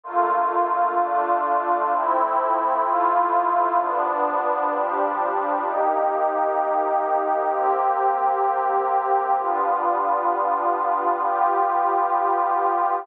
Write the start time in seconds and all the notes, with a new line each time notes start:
0.04 D3 A3 A#3 F4
0.98 D3 A3 D4 F4
1.91 F3 A3 C4 E4
2.84 F3 A3 E4 F4
3.78 G2 F3 B3 D4
4.70 G2 F3 G3 D4
5.63 C3 A#3 D#4 G4
7.49 C3 A#3 C4 G4
9.37 G3 B3 D4 F4
11.21 G3 B3 F4 G4